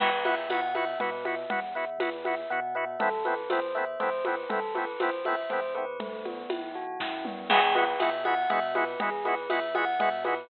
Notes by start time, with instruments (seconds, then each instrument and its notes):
0.00 synth bass 2 E2, drawbar organ B3 E4 F#4, tubular bells B4, crash, low conga
0.25 drawbar organ B3 E4 F#4, tubular bells E5, high conga
0.49 synth bass 2 B2, drawbar organ B3 E4 F#4, tubular bells F#5, tambourine, high conga
0.75 drawbar organ B3 E4 F#4, tubular bells E5, high conga
0.99 synth bass 2 B2, drawbar organ B3 E4 F#4, tubular bells B4, low conga
1.25 drawbar organ B3 E4 F#4, tubular bells E5, high conga
1.50 synth bass 2 E2, drawbar organ B3 E4 F#4, tubular bells F#5, low conga
1.75 drawbar organ B3 E4 F#4, tubular bells E5
1.98 synth bass 2 E2, drawbar organ B3 E4 F#4, tubular bells B4, tambourine, high conga
2.24 drawbar organ B3 E4 F#4, tubular bells E5, high conga
2.50 synth bass 2 B2, drawbar organ B3 E4 F#4, tubular bells F#5
2.75 drawbar organ B3 E4 F#4, tubular bells E5
2.99 synth bass 2 A1, drawbar organ A3 B3 C4 E4, tubular bells A4, low conga
3.25 drawbar organ A3 B3 C4 E4, tubular bells B4, high conga
3.50 synth bass 2 E2, drawbar organ A3 B3 C4 E4, tubular bells C5, tambourine, high conga
3.75 drawbar organ A3 B3 C4 E4, tubular bells E5
4.00 synth bass 2 E2, drawbar organ A3 B3 C4 E4, tubular bells C5, low conga
4.24 drawbar organ A3 B3 C4 E4, tubular bells B4, high conga
4.49 synth bass 2 A1, drawbar organ A3 B3 C4 E4, tubular bells A4, low conga
4.75 drawbar organ A3 B3 C4 E4, tubular bells B4, high conga
5.00 synth bass 2 A1, drawbar organ A3 B3 C4 E4, tubular bells C5, tambourine, high conga
5.25 drawbar organ A3 B3 C4 E4, tubular bells E5, high conga
5.50 synth bass 2 E2, drawbar organ A3 B3 C4 E4, tubular bells C5, low conga
5.75 drawbar organ A3 B3 C4 E4, tubular bells B4
5.99 synth bass 2 B1, tubular bells A3, low conga
6.25 tubular bells B3, high conga
6.50 synth bass 2 B1, tubular bells E4, tambourine, high conga
6.75 tubular bells F#4
7.00 synth bass 2 F#2, tubular bells E4, kick, snare
7.25 tubular bells B3, mid tom
7.49 synth bass 2 E2, drawbar organ G#3 B3 E4, tubular bells G#4, crash, low conga
7.53 drawbar organ F#4
7.75 drawbar organ G#3 B3 E4 F#4, tubular bells B4, high conga
8.00 synth bass 2 B2, drawbar organ G#3 B3 E4 F#4, tubular bells E5, tambourine, high conga
8.25 drawbar organ G#3 B3 E4 F#4, tubular bells F#5, high conga
8.50 synth bass 2 B2, drawbar organ G#3 B3 E4 F#4, tubular bells E5, low conga
8.75 drawbar organ G#3 B3 E4 F#4, tubular bells B4, high conga
9.00 synth bass 2 E2, drawbar organ G#3 B3 E4 F#4, tubular bells G#4, low conga
9.25 drawbar organ G#3 B3 E4 F#4, tubular bells B4, high conga
9.50 synth bass 2 E2, drawbar organ G#3 B3 E4 F#4, tubular bells E5, tambourine, high conga
9.75 drawbar organ G#3 B3 E4 F#4, tubular bells F#5, high conga
9.99 synth bass 2 B2, drawbar organ G#3 B3 E4 F#4, tubular bells E5, low conga
10.24 drawbar organ G#3 B3 E4 F#4, tubular bells B4, high conga